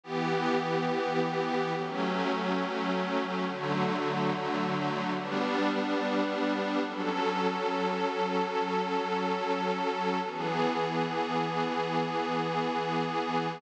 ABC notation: X:1
M:3/4
L:1/8
Q:1/4=106
K:Edor
V:1 name="Pad 5 (bowed)"
[E,B,G]6 | [F,A,C]6 | [D,F,A,]6 | [G,B,D]6 |
[K:F#dor] [F,CA]6- | [F,CA]6 | [E,B,G]6- | [E,B,G]6 |]